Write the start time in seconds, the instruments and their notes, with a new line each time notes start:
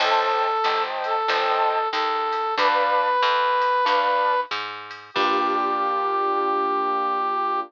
0.00 electric bass (finger) A1, brass section A4, acoustic grand piano C5 D#5 G5 A5, crash, ride
0.64 electric bass (finger) G1, acoustic grand piano C5 D#5 G5 A5, hi-hat pedal, ride
1.04 brass section A4, ride
1.28 electric bass (finger) G1, acoustic grand piano C5 D#5 G5 A5, ride
1.91 electric bass (finger) D#2, brass section A4, hi-hat pedal, ride
2.32 ride
2.58 electric bass (finger) D2, acoustic grand piano B4 D5 F5 A5, brass section B4, kick, ride
3.22 electric bass (finger) F2, hi-hat pedal, ride
3.61 ride
3.85 electric bass (finger) D2, acoustic grand piano B4 D5 F5 A5, ride
4.51 electric bass (finger) G#2, hi-hat pedal, ride
4.91 ride
5.14 electric bass (finger) G2, acoustic grand piano A#3 D4 F4 G4, brass section G4, kick, crash